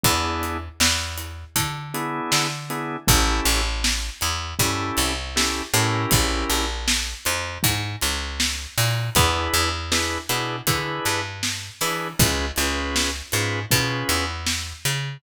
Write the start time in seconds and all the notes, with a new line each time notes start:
0.03 E2 B3 D4 E4 G#4, kick, closed hi-hat
0.43 closed hi-hat
0.80 E2, snare
1.18 closed hi-hat
1.56 D3, kick, closed hi-hat
1.94 B3 D4 E4 G#4, closed hi-hat
2.32 D3, snare
2.70 B3 D4 E4 G#4, closed hi-hat
3.07 A1 C#4 E4 G4 A4, kick, closed hi-hat
3.45 A1, closed hi-hat
3.84 snare
4.21 E2, closed hi-hat
4.59 G2 C#4 E4 G4 A4, kick, closed hi-hat
4.97 C2, closed hi-hat
5.36 C#4 E4 G4 A4, snare
5.74 A2 C#4 E4 G4 A#4, closed hi-hat
6.11 A#1, kick, closed hi-hat
6.50 A#1, closed hi-hat
6.88 snare
7.25 F2, closed hi-hat
7.63 G#2, kick, closed hi-hat
8.01 C#2, closed hi-hat
8.40 snare
8.78 A#2, open hi-hat
9.15 E2 D4 E4 G#4 B4, kick, closed hi-hat
9.54 E2, closed hi-hat
9.91 D4 E4 G#4 B4, snare
10.29 B2 D4 E4 G#4 B4, closed hi-hat
10.67 D3 D4 E4 G#4 B4, kick, closed hi-hat
11.05 G2, closed hi-hat
11.43 snare
11.81 E3 D4 E4 G#4 B4, open hi-hat
12.19 C#2 C#4 F4 G#4 B4, kick, closed hi-hat
12.56 C#2 C#4 F4 G#4 B4, closed hi-hat
12.96 snare
13.32 G#2 C#4 F4 G#4 B4, closed hi-hat
13.71 B2 C#4 F4 G#4 B4, kick, closed hi-hat
14.09 E2, closed hi-hat
14.47 snare
14.85 C#3, closed hi-hat